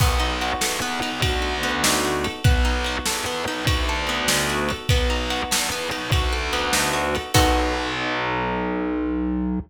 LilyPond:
<<
  \new Staff \with { instrumentName = "Acoustic Guitar (steel)" } { \time 12/8 \key b \major \tempo 4. = 98 b8 dis'8 fis'8 a'8 b8 dis'8 fis'8 a'8 b8 dis'8 fis'8 a'8 | b8 dis'8 fis'8 a'8 b8 dis'8 fis'8 a'8 b8 dis'8 fis'8 a'8 | b8 dis'8 fis'8 a'8 b8 dis'8 fis'8 a'8 b8 dis'8 fis'8 a'8 | <b dis' fis' a'>1. | }
  \new Staff \with { instrumentName = "Electric Bass (finger)" } { \clef bass \time 12/8 \key b \major b,,4. e,8 e,8 b,,8 d,2. | b,,4. e,8 e,8 b,,8 d,2. | b,,4. e,8 e,8 b,,8 d,2. | b,,1. | }
  \new DrumStaff \with { instrumentName = "Drums" } \drummode { \time 12/8 <cymc bd>4 cymr8 sn4 cymr8 <bd cymr>4 cymr8 sn4 cymr8 | <bd cymr>4 cymr8 sn4 cymr8 <bd cymr>4 cymr8 sn4 cymr8 | <bd cymr>4 cymr8 sn4 cymr8 <bd cymr>4 cymr8 sn4 cymr8 | <cymc bd>4. r4. r4. r4. | }
>>